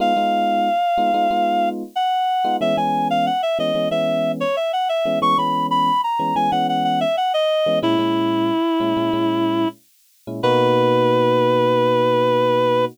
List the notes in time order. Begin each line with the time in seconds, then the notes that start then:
0.00 G#3 B3 D#4 F4 F5
0.16 G#3 B3 D#4 F4
0.98 G#3 B3 D#4 F4
1.14 G#3 B3 D#4 F4
1.31 G#3 B3 D#4 F4
1.96 F#5
2.44 G#3 B3 D#4 F4
2.61 E3 G#3 B3 C#4 E5
2.77 E3 G#3 B3 C#4 G#5
3.10 F5
3.26 F#5
3.43 E5
3.59 E3 G#3 B3 C#4 D#5
3.75 E3 G#3 B3 C#4
3.91 E3 G#3 B3 C#4 E5
4.40 C#5
4.56 E5
4.73 F#5
4.89 E5
5.05 E3 G#3 B3 C#4
5.22 E3 G#3 B3 C#4 C#6
5.38 E3 G#3 B3 C#4 B5
5.71 B5
6.04 A#5
6.19 E3 G#3 B3 C#4
6.36 E3 G#3 B3 C#4 G#5
6.51 E3 G#3 B3 C#4 F#5
6.69 F#5
6.84 F#5
7.01 E5
7.17 F#5
7.34 D#5
7.66 E3 G#3 B3 C#4
7.82 A#2 G#3 C#4 E4
7.99 A#2 G#3 C#4 E4
8.80 A#2 G#3 C#4 E4
8.97 A#2 G#3 C#4 E4
9.13 A#2 G#3 C#4 E4
10.27 A#2 G#3 C#4 E4
10.43 B2 A#3 D#4 F#4 B4